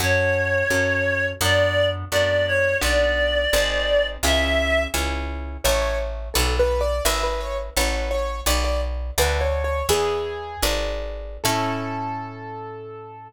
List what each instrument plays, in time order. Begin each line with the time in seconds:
0.00 electric bass (finger) F#2, orchestral harp C#4 F#4 A4, clarinet C#5
0.70 electric bass (finger) F#2, orchestral harp C#4 F#4 A4
1.41 electric bass (finger) F#2, orchestral harp B3 D4 F#4, clarinet D5
2.11 electric bass (finger) F#2, orchestral harp B3 D4 F#4, clarinet D5
2.47 clarinet C#5
2.81 electric bass (finger) B1, orchestral harp B3 D4 F#4, clarinet D5
3.53 electric bass (finger) G#1, orchestral harp C4 D#4 G#4
4.23 electric bass (finger) C#2, orchestral harp C#4 E4 G#4, clarinet E5
4.94 electric bass (finger) C#2, orchestral harp C#4 E4 G#4
5.64 electric bass (finger) A1, acoustic grand piano C#5, orchestral harp C#5 E5 A5
5.82 acoustic grand piano C#5
6.34 electric bass (finger) B1, acoustic grand piano A4, orchestral harp B4 D5 F#5
6.59 acoustic grand piano B4
6.81 acoustic grand piano D5
7.05 electric bass (finger) G#1, orchestral harp B4 E5 G#5, acoustic grand piano E5
7.23 acoustic grand piano B4
7.41 acoustic grand piano C#5
7.76 electric bass (finger) A1, acoustic grand piano B4, orchestral harp C#5 F#5 A5
8.11 acoustic grand piano C#5
8.46 electric bass (finger) B1, orchestral harp B4 D5 F#5, acoustic grand piano D5
8.64 acoustic grand piano D5
9.18 electric bass (finger) D2, orchestral harp A4 D5 F#5, acoustic grand piano B4
9.41 acoustic grand piano C#5
9.64 acoustic grand piano C#5
9.89 electric bass (finger) E2, orchestral harp G#4 B4 E5, acoustic grand piano G#4
10.62 electric bass (finger) G#1, orchestral harp G#4 B4 D5
11.44 electric bass (finger) A2, orchestral harp C#4 E4 A4, acoustic grand piano A4